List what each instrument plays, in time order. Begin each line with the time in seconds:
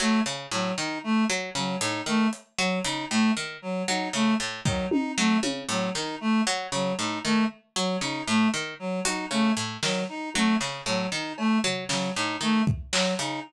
0.00 pizzicato strings F#3, clarinet A3, clap
0.26 pizzicato strings C#3, cowbell
0.51 pizzicato strings A2, clarinet F#3
0.78 pizzicato strings D#3, clarinet D#4
1.04 clarinet A3
1.30 pizzicato strings F#3
1.55 pizzicato strings C#3, clarinet F#3
1.81 pizzicato strings A2, clarinet D#4, closed hi-hat
2.06 pizzicato strings D#3, clarinet A3
2.33 closed hi-hat
2.59 pizzicato strings F#3, clarinet F#3
2.84 pizzicato strings C#3, clarinet D#4, closed hi-hat
3.10 pizzicato strings A2, clarinet A3
3.37 pizzicato strings D#3
3.62 clarinet F#3
3.88 pizzicato strings F#3, clarinet D#4
4.13 pizzicato strings C#3, clarinet A3
4.40 pizzicato strings A2
4.65 pizzicato strings D#3, clarinet F#3, kick
4.91 clarinet D#4, high tom
5.17 pizzicato strings F#3, clarinet A3
5.43 pizzicato strings C#3, high tom
5.69 pizzicato strings A2, clarinet F#3, closed hi-hat
5.95 pizzicato strings D#3, clarinet D#4, snare
6.21 clarinet A3
6.47 pizzicato strings F#3
6.72 pizzicato strings C#3, clarinet F#3
6.98 pizzicato strings A2, clarinet D#4
7.24 pizzicato strings D#3, clarinet A3
7.76 clarinet F#3, pizzicato strings F#3
8.01 pizzicato strings C#3, clarinet D#4
8.27 pizzicato strings A2, clarinet A3
8.54 pizzicato strings D#3
8.79 clarinet F#3
9.05 pizzicato strings F#3, clarinet D#4, closed hi-hat
9.31 pizzicato strings C#3, clarinet A3
9.57 pizzicato strings A2, closed hi-hat
9.83 pizzicato strings D#3, clarinet F#3, snare
10.09 clarinet D#4
10.34 pizzicato strings F#3, clarinet A3, high tom
10.60 pizzicato strings C#3, clap
10.86 pizzicato strings A2, clarinet F#3
11.12 pizzicato strings D#3, clarinet D#4
11.38 clarinet A3, cowbell
11.64 pizzicato strings F#3, floor tom
11.89 pizzicato strings C#3, clarinet F#3, snare
12.15 pizzicato strings A2, clarinet D#4
12.41 pizzicato strings D#3, clarinet A3
12.67 kick
12.93 pizzicato strings F#3, clarinet F#3, clap
13.19 pizzicato strings C#3, clarinet D#4, closed hi-hat